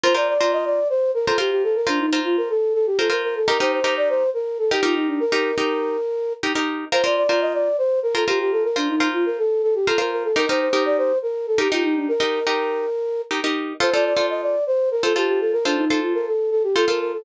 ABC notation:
X:1
M:7/8
L:1/16
Q:1/4=122
K:Fmix
V:1 name="Flute"
c d d2 e d2 c2 B A G G A | B D E2 F B A2 A G A B B A | B c c2 d c2 B2 A G F E D | B10 z4 |
c d d2 e d2 c2 B A G G A | B D E2 F B A2 A G A B B A | B c c2 d c2 B2 A G F E D | B10 z4 |
c d d2 e d2 c2 B A G G A | B D E2 F B A2 A G A B B A |]
V:2 name="Pizzicato Strings"
[FBc] [FBc]2 [FBc]7 [FBc] [FBc]3- | [FBc] [FBc]2 [FBc]7 [FBc] [FBc]3 | [EGB] [EGB]2 [EGB]7 [EGB] [EGB]3- | [EGB] [EGB]2 [EGB]7 [EGB] [EGB]3 |
[FBc] [FBc]2 [FBc]7 [FBc] [FBc]3- | [FBc] [FBc]2 [FBc]7 [FBc] [FBc]3 | [EGB] [EGB]2 [EGB]7 [EGB] [EGB]3- | [EGB] [EGB]2 [EGB]7 [EGB] [EGB]3 |
[FAc] [FAc]2 [FAc]7 [FAc] [FAc]3- | [FAc] [FAc]2 [FAc]7 [FAc] [FAc]3 |]